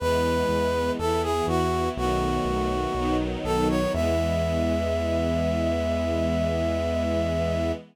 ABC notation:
X:1
M:4/4
L:1/16
Q:1/4=61
K:E
V:1 name="Brass Section"
B4 A G F2 F6 A c | e16 |]
V:2 name="String Ensemble 1"
[E,G,B,]4 [E,B,E]4 [D,F,A,B,]4 [D,F,B,D]4 | [E,G,B,]16 |]
V:3 name="Synth Bass 1" clef=bass
E,,2 E,,2 E,,2 E,,2 B,,,2 B,,,2 B,,,2 B,,,2 | E,,16 |]